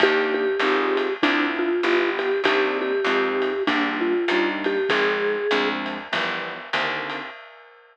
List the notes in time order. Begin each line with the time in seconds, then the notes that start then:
0.00 D#2 A#3 D4 D#4 G4, kick, ride
0.34 G4
0.59 G#1 C4 D#4 F4 G#4, ride
0.97 ride
1.22 D2 C4 D4 E4 F4, kick, ride
1.59 F4
1.83 G1 B3 E4 F4 G4, hi-hat pedal
2.19 G4, ride
2.44 C2 A#3 C4 D4 D#4 G4, kick, ride
2.81 G4
3.04 F2 G#3 C4 D#4 F4, hi-hat pedal, ride
3.42 ride
3.67 A#1 G3 A#3 D4 F4, kick, ride
4.01 F4
4.28 D#2 G3 A#3 D4 D#4, hi-hat pedal, ride
4.64 G4, ride
4.89 G#1 F3 G#3 C4 D#4 G#4, kick, ride
5.51 D2 F3 G#3 C4 D4, hi-hat pedal, ride
5.86 ride
6.12 G1 E3 F3 G3 B3, kick, ride
6.73 C2 D3 D#3 A#3 C4, hi-hat pedal, ride
7.10 ride